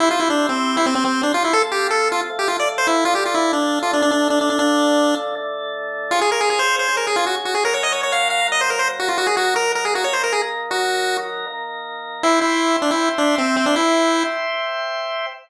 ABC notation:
X:1
M:4/4
L:1/16
Q:1/4=157
K:C
V:1 name="Lead 1 (square)"
E F E D2 C3 E C C C2 D F E | A z G2 A2 F z2 G F d z c E2 | F G F E2 D3 F D D D2 D D D | D6 z10 |
[K:Db] F A B A A c2 c2 B A F G z G A | B d e d d f2 f2 e c B c z G F | G A G2 B2 B A G d c B A z3 | G6 z10 |
[K:C] E2 E4 D E2 z D2 C2 C D | E6 z10 |]
V:2 name="Drawbar Organ"
[CEG]8 [CGc]8 | [F,CA]8 [F,A,A]8 | [D,F,A]8 [D,A,A]8 | [D,F,A]8 [D,A,A]8 |
[K:Db] [DFA]8 [DAd]8 | [G,DB]8 [G,B,B]8 | [E,G,B]8 [E,B,B]8 | [E,G,B]8 [E,B,B]8 |
[K:C] [ceg]16- | [ceg]16 |]